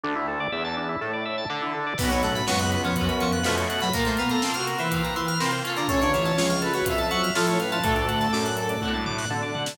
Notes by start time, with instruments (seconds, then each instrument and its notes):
0.04 synth bass 1 D2, drawbar organ D4
0.16 drawbar organ E4
0.28 drawbar organ A4
0.40 drawbar organ D5
0.52 synth bass 1 E2, drawbar organ E5
0.65 drawbar organ A5
0.77 drawbar organ D4
0.89 drawbar organ E4
1.01 synth bass 1 A2, drawbar organ A4
1.13 drawbar organ D5
1.25 drawbar organ E5
1.38 drawbar organ A5
1.50 synth bass 1 D3, drawbar organ D4
1.62 drawbar organ E4
1.74 drawbar organ A4
1.86 drawbar organ D5
1.98 synth bass 1 B1, electric piano 2 B2 B3, lead 1 (square) F#3, overdriven guitar B3 C#4, string ensemble 1 B3 C#4 F#4, drawbar organ B4, kick, crash
2.03 overdriven guitar F#4
2.10 electric piano 2 B2 B3, drawbar organ C#5, closed hi-hat
2.23 electric piano 2 A2 A3, drawbar organ F#5, closed hi-hat
2.35 drawbar organ B5, snare, closed hi-hat
2.47 synth bass 1 C#2, electric piano 2 F#2 F#3, overdriven guitar B3 C#4, lead 1 (square) B3, drawbar organ C#6, snare
2.52 overdriven guitar F#4
2.59 drawbar organ F#6, closed hi-hat
2.72 drawbar organ B4, closed hi-hat
2.84 electric piano 2 F2 F3, drawbar organ C#5, closed hi-hat
2.96 synth bass 1 F#2, overdriven guitar B3, drawbar organ F#5, kick, closed hi-hat
3.01 overdriven guitar C#4 F#4
3.09 drawbar organ B5, closed hi-hat
3.20 electric piano 2 F2 F3, drawbar organ C#6, snare, closed hi-hat
3.32 drawbar organ F#6, closed hi-hat
3.43 electric piano 2 F2 F3, synth bass 1 B2, lead 1 (square) A3, overdriven guitar B3 C#4, drawbar organ B4, snare
3.49 overdriven guitar F#4
3.57 drawbar organ C#5, closed hi-hat
3.70 drawbar organ F#5, closed hi-hat
3.81 electric piano 2 F#2 F#3, drawbar organ B5, closed hi-hat
3.93 electric piano 2 A#2 A#3, string ensemble 1 A#3 C4 F4, overdriven guitar A#3 C4, lead 1 (square) A#4, drawbar organ A#4, kick, closed hi-hat
3.99 overdriven guitar F4
4.05 electric piano 2 A2 A3, drawbar organ C5, closed hi-hat
4.17 electric piano 2 B2 B3, drawbar organ F5, closed hi-hat
4.29 lead 1 (square) A4, drawbar organ A#5, snare, closed hi-hat
4.42 electric piano 2 C3 C4, overdriven guitar A#3, drawbar organ C6, snare
4.47 overdriven guitar C4 F4
4.54 lead 1 (square) F#4, drawbar organ F6, closed hi-hat
4.67 drawbar organ A#4, closed hi-hat
4.78 electric piano 2 E3 E4, lead 1 (square) B4, drawbar organ C5, closed hi-hat
4.91 overdriven guitar A#3 C4, drawbar organ F5, kick, closed hi-hat
4.96 overdriven guitar F4
5.04 drawbar organ A#5, closed hi-hat
5.16 electric piano 2 E3 E4, drawbar organ C6, closed hi-hat
5.28 drawbar organ F6, closed hi-hat
5.40 electric piano 2 C3 C4, overdriven guitar A#3 C4, drawbar organ A#4, snare
5.46 overdriven guitar F4
5.51 drawbar organ C5, closed hi-hat
5.64 overdriven guitar C#4 F4, drawbar organ F5, closed hi-hat
5.70 overdriven guitar A4
5.77 electric piano 2 D3 D4, drawbar organ A#5, closed hi-hat
5.88 synth bass 1 A1, electric piano 2 C#3 C#4, string ensemble 1 A3 C#4 F4, drawbar organ A4, lead 1 (square) C#5, kick, closed hi-hat
6.01 electric piano 2 D3 D4, drawbar organ C#5, closed hi-hat
6.13 electric piano 2 E3 E4, drawbar organ F5, snare, closed hi-hat
6.25 drawbar organ A5, snare, closed hi-hat
6.38 synth bass 1 C#2, electric piano 2 F3 F4, drawbar organ C#6, snare
6.50 drawbar organ F6, closed hi-hat
6.62 drawbar organ A4, lead 1 (square) B4, closed hi-hat
6.74 electric piano 2 F#3 F#4, drawbar organ C#5, closed hi-hat
6.85 synth bass 1 F2, overdriven guitar C#4 F4, lead 1 (square) E5, drawbar organ F5, kick, closed hi-hat
6.90 overdriven guitar A4
6.98 lead 1 (square) E5, drawbar organ A5, closed hi-hat
7.10 electric piano 2 F#3 F#4, lead 1 (square) E5, drawbar organ C#6, closed hi-hat
7.23 drawbar organ F6, closed hi-hat
7.35 synth bass 1 A2, electric piano 2 F3 F4, lead 1 (square) A4, drawbar organ A4, snare
7.47 drawbar organ C#5, closed hi-hat
7.60 lead 1 (square) B4, drawbar organ F5, closed hi-hat
7.72 electric piano 2 F3 F4, drawbar organ A5, closed hi-hat
7.83 synth bass 1 D2, electric piano 2 A2 A3, string ensemble 1 A3 D4 F#4, overdriven guitar D4 F#4, lead 1 (square) A4, drawbar organ A4, kick, closed hi-hat
7.89 overdriven guitar A4
7.96 drawbar organ D5, closed hi-hat
8.08 drawbar organ F#5, closed hi-hat
8.21 drawbar organ A5, snare, closed hi-hat
8.33 synth bass 1 F#2, drawbar organ D6, snare
8.45 drawbar organ F#6, closed hi-hat
8.57 drawbar organ A4, lead 1 (square) A4, closed hi-hat
8.69 drawbar organ D5, closed hi-hat
8.81 synth bass 1 A2, overdriven guitar D4 F#4, drawbar organ F#5, kick, high tom
8.88 overdriven guitar A4
8.94 drawbar organ A5, mid tom
9.06 drawbar organ D6, floor tom
9.18 drawbar organ F#6, snare
9.30 synth bass 1 D3, drawbar organ A4, high tom
9.43 drawbar organ D5
9.55 drawbar organ F#5, floor tom
9.66 drawbar organ A5, snare